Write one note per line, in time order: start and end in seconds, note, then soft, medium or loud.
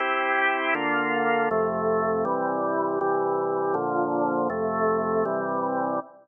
0.00 0.74 C4 medium
0.00 0.74 E4 medium
0.00 0.74 G4 medium
0.75 1.49 D3 medium
0.75 1.49 A#3 medium
0.75 1.49 F4 medium
1.51 2.25 F2 medium
1.51 2.24 C3 medium
1.51 2.25 A3 medium
2.25 2.99 C3 medium
2.25 2.99 E3 medium
2.25 2.99 G3 medium
3.01 3.75 C3 medium
3.01 3.75 E3 medium
3.01 3.75 G3 medium
3.74 4.48 A#2 medium
3.74 4.48 D3 medium
3.74 4.48 F3 medium
4.50 5.24 F2 medium
4.50 5.24 C3 medium
4.50 5.24 A3 medium
5.25 6.00 C3 medium
5.25 6.00 E3 medium
5.25 6.00 G3 medium